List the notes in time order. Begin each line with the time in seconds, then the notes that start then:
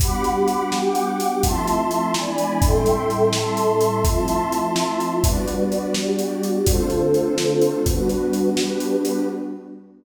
0.00 G3 B3 D4 F#4 G4 F#5 B5 D6, kick, closed hi-hat
0.24 closed hi-hat
0.48 closed hi-hat
0.70 G4 F#5 G5 D6, snare
0.95 closed hi-hat
1.20 closed hi-hat
1.42 F3 A3 C4 E4 F4 E5 A5 C6, kick, closed hi-hat
1.67 closed hi-hat
1.91 closed hi-hat
2.14 E3 G#3 B3 D4 E4 D5 G#5 B5, snare
2.38 closed hi-hat
2.62 A2 G3 C4 E4 A4 E5 G5 C6, kick, closed hi-hat
2.86 closed hi-hat
3.10 closed hi-hat
3.33 A4 E5 A5 C6, snare
3.57 closed hi-hat
3.81 closed hi-hat
4.03 F3 A3 C4 E4 F4 E5 A5 C6, kick, closed hi-hat
4.28 closed hi-hat
4.52 closed hi-hat
4.76 snare
5.00 closed hi-hat
5.22 G3 B3 D4 F#4 B4 D5, kick, closed hi-hat
5.48 closed hi-hat
5.72 closed hi-hat
5.94 G3 F#4 G4 D5, snare
6.19 closed hi-hat
6.43 closed hi-hat
6.65 D3 A3 C4 D4 F4 A4 C5, kick, closed hi-hat
6.90 closed hi-hat
7.14 closed hi-hat
7.38 snare
7.62 closed hi-hat
7.86 G3 B3 D4 F#4 B4, kick, closed hi-hat
8.09 closed hi-hat
8.33 closed hi-hat
8.57 G3 D4 G4 B4, snare
8.80 closed hi-hat
9.05 closed hi-hat